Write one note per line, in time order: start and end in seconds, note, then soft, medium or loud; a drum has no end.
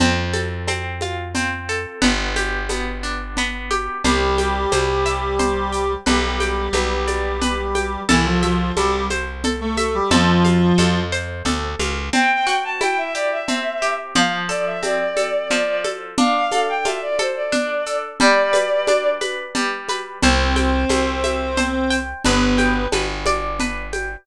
0.00 1.86 F2 medium
0.00 0.68 C4 medium
0.00 cowbell medium
0.00 low conga medium
0.00 shaker medium
0.33 1.68 A4 medium
0.33 high conga medium
0.33 shaker soft
0.67 1.34 C4 medium
0.67 cowbell medium
0.67 high conga medium
0.67 shaker medium
1.01 1.98 F4 medium
1.01 high conga medium
1.01 shaker soft
1.35 1.99 C4 medium
1.35 cowbell medium
1.35 low conga medium
1.35 shaker medium
1.69 2.01 A4 medium
1.69 shaker medium
2.02 3.89 G1 medium
2.02 2.69 B3 medium
2.02 cowbell medium
2.02 low conga medium
2.02 shaker medium
2.36 3.70 G4 medium
2.36 high conga medium
2.36 shaker medium
2.69 3.37 B3 medium
2.69 cowbell medium
2.69 high conga medium
2.69 shaker medium
3.03 3.99 D4 soft
3.03 shaker soft
3.37 4.02 B3 medium
3.37 cowbell medium
3.37 low conga medium
3.37 shaker medium
3.71 4.03 G4 medium
3.71 high conga medium
3.71 shaker soft
4.04 4.66 C2 medium
4.04 5.92 G3 loud
4.04 5.92 G4 loud
4.04 4.71 C5 medium
4.04 cowbell medium
4.04 low conga medium
4.04 shaker medium
4.38 5.72 G5 medium
4.38 high conga medium
4.38 shaker medium
4.72 5.96 C2 medium
4.72 5.39 C5 medium
4.72 cowbell medium
4.72 high conga medium
4.72 shaker medium
5.06 6.02 E5 medium
5.06 shaker medium
5.39 6.03 C5 medium
5.39 cowbell medium
5.39 low conga medium
5.39 shaker medium
5.72 6.04 G5 medium
5.72 shaker medium
6.06 6.69 B1 medium
6.06 8.01 G3 medium
6.06 8.01 G4 medium
6.06 6.74 B4 medium
6.06 cowbell medium
6.06 low conga medium
6.06 shaker medium
6.40 7.74 G5 medium
6.40 high conga medium
6.40 shaker medium
6.73 7.97 B1 medium
6.73 7.41 B4 medium
6.73 cowbell medium
6.73 high conga medium
6.73 shaker medium
7.07 8.04 D5 medium
7.07 high conga medium
7.07 shaker medium
7.41 8.05 B4 medium
7.41 cowbell medium
7.41 low conga medium
7.41 shaker medium
7.75 8.07 G5 medium
7.75 high conga medium
7.75 shaker medium
8.09 8.72 C2 medium
8.09 8.25 E3 medium
8.09 8.25 E4 loud
8.09 8.77 A4 medium
8.09 cowbell medium
8.09 low conga medium
8.09 shaker medium
8.26 8.42 F3 medium
8.26 8.42 F4 medium
8.43 8.72 F3 medium
8.43 8.72 F4 loud
8.43 9.77 E5 medium
8.43 high conga medium
8.43 shaker soft
8.76 10.01 C2 medium
8.76 9.04 G3 medium
8.76 9.04 G4 loud
8.76 9.44 A4 medium
8.76 cowbell medium
8.76 high conga medium
8.76 shaker medium
9.10 10.07 C5 medium
9.10 high conga medium
9.10 shaker medium
9.44 10.09 A4 medium
9.44 cowbell medium
9.44 low conga medium
9.44 shaker medium
9.61 9.77 A3 medium
9.61 9.77 A4 medium
9.77 9.94 A3 medium
9.77 9.94 A4 medium
9.77 10.10 E5 medium
9.77 high conga medium
9.77 shaker medium
9.94 10.10 G3 medium
9.94 10.10 G4 medium
10.11 10.73 F2 medium
10.11 11.00 F3 loud
10.11 11.00 F4 loud
10.11 10.78 A4 medium
10.11 cowbell medium
10.11 low conga medium
10.11 shaker medium
10.45 11.79 F5 medium
10.45 high conga medium
10.45 shaker medium
10.78 11.43 F2 medium
10.78 11.45 A4 medium
10.78 cowbell medium
10.78 high conga medium
10.78 shaker medium
11.12 12.08 C5 medium
11.12 shaker medium
11.45 11.75 D2 medium
11.45 12.10 A4 medium
11.45 cowbell medium
11.45 low conga medium
11.45 shaker medium
11.79 12.10 C#2 medium
11.79 12.12 F5 medium
11.79 high conga medium
11.79 shaker medium
12.13 13.48 C4 medium
12.13 12.58 G5 medium
12.13 cowbell medium
12.13 low conga medium
12.13 shaker medium
12.47 14.07 F#4 medium
12.47 shaker medium
12.64 12.80 A5 medium
12.81 14.09 E4 medium
12.81 12.97 G5 medium
12.81 cowbell medium
12.81 high conga medium
12.81 shaker medium
12.98 13.14 E5 medium
13.15 13.81 G4 medium
13.15 13.31 D5 medium
13.15 shaker medium
13.31 13.92 E5 medium
13.48 14.12 C4 medium
13.48 cowbell medium
13.48 low conga medium
13.48 shaker medium
13.82 14.14 G4 medium
13.82 shaker soft
14.15 15.50 F3 medium
14.15 14.32 F5 medium
14.15 cowbell medium
14.15 low conga medium
14.15 shaker medium
14.49 15.16 A4 medium
14.49 14.65 D5 medium
14.49 shaker medium
14.66 14.82 E5 medium
14.83 16.11 C4 medium
14.83 15.47 D5 medium
14.83 cowbell medium
14.83 high conga medium
14.83 shaker medium
15.17 15.84 A4 medium
15.17 high conga medium
15.17 shaker medium
15.51 16.15 F3 medium
15.51 15.82 D5 medium
15.51 cowbell medium
15.51 low conga medium
15.51 shaker medium
15.84 16.16 A4 medium
15.84 high conga medium
15.84 shaker soft
16.18 17.52 D4 medium
16.18 16.65 F5 medium
16.18 cowbell medium
16.18 low conga medium
16.18 shaker medium
16.52 17.19 A4 medium
16.52 high conga medium
16.52 shaker medium
16.69 16.85 G5 medium
16.85 18.13 F4 medium
16.85 17.01 E5 medium
16.85 cowbell medium
16.85 high conga medium
16.85 shaker medium
17.02 17.18 D5 medium
17.19 17.86 A4 medium
17.19 17.35 C5 medium
17.19 high conga medium
17.19 shaker soft
17.36 17.97 D5 medium
17.52 18.16 D4 medium
17.52 cowbell medium
17.52 low conga medium
17.52 shaker medium
17.86 18.19 A4 medium
17.86 shaker medium
18.20 19.54 G3 medium
18.20 19.07 D5 medium
18.20 cowbell medium
18.20 low conga medium
18.20 shaker medium
18.53 19.21 B4 medium
18.53 high conga medium
18.53 shaker medium
18.87 20.16 D4 medium
18.87 cowbell medium
18.87 high conga medium
18.87 shaker medium
19.21 19.89 B4 medium
19.21 high conga medium
19.21 shaker medium
19.55 20.19 G3 medium
19.55 cowbell medium
19.55 low conga medium
19.55 shaker medium
19.89 20.21 B4 medium
19.89 high conga medium
19.89 shaker medium
20.22 20.85 C2 medium
20.22 21.97 C4 loud
20.22 21.97 C5 loud
20.22 20.89 C5 medium
20.22 cowbell medium
20.22 low conga medium
20.22 shaker medium
20.56 21.90 G5 medium
20.56 high conga medium
20.56 shaker medium
20.89 22.14 C2 medium
20.89 21.57 C5 medium
20.89 cowbell medium
20.89 high conga medium
20.89 shaker medium
21.24 22.20 E5 medium
21.24 high conga medium
21.24 shaker medium
21.57 22.21 C5 medium
21.57 cowbell medium
21.57 low conga medium
21.57 shaker medium
21.90 22.22 G5 medium
21.90 shaker medium
22.25 22.87 G1 medium
22.25 22.85 B3 medium
22.25 22.85 B4 loud
22.25 22.93 B4 medium
22.25 cowbell medium
22.25 low conga medium
22.25 shaker medium
22.58 23.92 G5 medium
22.58 high conga medium
22.58 shaker medium
22.92 24.17 G1 medium
22.92 23.60 B4 medium
22.92 cowbell medium
22.92 high conga medium
22.92 shaker medium
23.26 24.22 D5 medium
23.26 high conga medium
23.26 shaker medium
23.60 24.24 B4 medium
23.60 cowbell medium
23.60 low conga medium
23.60 shaker medium
23.93 24.25 G5 medium
23.93 high conga medium
23.93 shaker soft